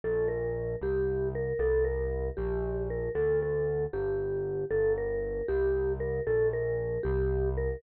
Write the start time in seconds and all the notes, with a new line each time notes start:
0.04 A#1 A4
0.28 A#4
0.81 C2 G4
1.35 A#4
1.59 C2 A4
1.85 A#4
2.37 A#1 G4
2.90 A#4
3.15 D2 A4
3.43 A4
3.93 G1 G4
4.71 G1 A4
4.98 A#4
5.48 C2 G4
6.00 A#4
6.27 A#1 A4
6.53 A#4
7.03 C2 G4
7.57 A#4